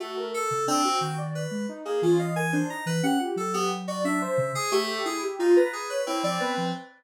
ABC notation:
X:1
M:5/8
L:1/16
Q:1/4=89
K:none
V:1 name="Ocarina"
^F ^A z2 D F2 d z2 | ^D ^G F ^d ^A =D ^D z =G2 | z G z d D c z2 G2 | E G F B z ^c E d B z |]
V:2 name="Electric Piano 2"
A,2 A2 C2 g z B2 | z ^A, ^C f ^g =c ^a B ^f z | A B, z ^F e e2 ^G A,2 | ^G z ^D ^a G B C C3 |]
V:3 name="Ocarina"
z3 ^C, z2 ^D,3 ^G, | z2 E,4 z E, ^C F | ^F,6 ^C, z3 | z7 F, B, F, |]